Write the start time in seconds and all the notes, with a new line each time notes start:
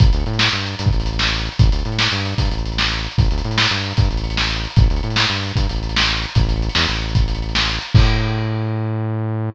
0.00 A1, kick, closed hi-hat
0.07 closed hi-hat
0.13 D2, closed hi-hat
0.20 closed hi-hat
0.26 A2, closed hi-hat
0.33 closed hi-hat
0.39 snare
0.47 closed hi-hat
0.53 G2, closed hi-hat
0.60 closed hi-hat
0.66 closed hi-hat
0.73 closed hi-hat
0.79 G2, closed hi-hat
0.86 kick, closed hi-hat
0.93 A1, closed hi-hat
1.00 closed hi-hat
1.06 closed hi-hat
1.13 closed hi-hat
1.19 snare
1.26 closed hi-hat
1.33 closed hi-hat
1.39 closed hi-hat
1.45 closed hi-hat
1.52 closed hi-hat
1.59 A1, kick, closed hi-hat
1.66 closed hi-hat
1.72 D2, closed hi-hat
1.79 closed hi-hat
1.85 A2, closed hi-hat
1.92 closed hi-hat
1.99 snare
2.05 closed hi-hat
2.12 G2, closed hi-hat
2.19 closed hi-hat
2.26 closed hi-hat
2.32 closed hi-hat
2.38 G2, kick, closed hi-hat
2.45 closed hi-hat
2.51 A1, closed hi-hat
2.58 closed hi-hat
2.66 closed hi-hat
2.72 closed hi-hat
2.78 snare
2.85 closed hi-hat
2.91 closed hi-hat
2.98 closed hi-hat
3.04 closed hi-hat
3.11 closed hi-hat
3.18 A1, kick, closed hi-hat
3.25 closed hi-hat
3.31 D2, closed hi-hat
3.38 closed hi-hat
3.44 A2, closed hi-hat
3.51 closed hi-hat
3.58 snare
3.64 closed hi-hat
3.71 G2, closed hi-hat
3.77 closed hi-hat
3.84 closed hi-hat
3.91 closed hi-hat
3.97 G2, kick, closed hi-hat
4.04 closed hi-hat
4.11 A1, closed hi-hat
4.17 closed hi-hat
4.24 closed hi-hat
4.30 closed hi-hat
4.37 snare
4.43 closed hi-hat
4.50 closed hi-hat
4.56 closed hi-hat
4.64 closed hi-hat
4.70 closed hi-hat
4.76 A1, kick, closed hi-hat
4.83 closed hi-hat
4.90 D2, closed hi-hat
4.96 closed hi-hat
5.03 A2, closed hi-hat
5.10 closed hi-hat
5.16 snare
5.24 closed hi-hat
5.30 G2, closed hi-hat
5.36 closed hi-hat
5.43 closed hi-hat
5.49 closed hi-hat
5.56 G2, kick, closed hi-hat
5.63 closed hi-hat
5.69 A1, closed hi-hat
5.76 closed hi-hat
5.83 closed hi-hat
5.89 closed hi-hat
5.96 snare
6.02 closed hi-hat
6.09 closed hi-hat
6.16 closed hi-hat
6.22 closed hi-hat
6.29 closed hi-hat
6.35 A1, kick, closed hi-hat
6.43 closed hi-hat
6.49 closed hi-hat
6.56 closed hi-hat
6.62 closed hi-hat
6.69 closed hi-hat
6.75 E2, snare
6.82 closed hi-hat
6.89 A1, closed hi-hat
6.96 closed hi-hat
7.02 closed hi-hat
7.09 closed hi-hat
7.15 kick, closed hi-hat
7.22 closed hi-hat
7.28 closed hi-hat
7.35 closed hi-hat
7.42 closed hi-hat
7.49 closed hi-hat
7.55 snare
7.62 closed hi-hat
7.69 closed hi-hat
7.74 closed hi-hat
7.81 closed hi-hat
7.88 closed hi-hat
7.95 A2, kick, crash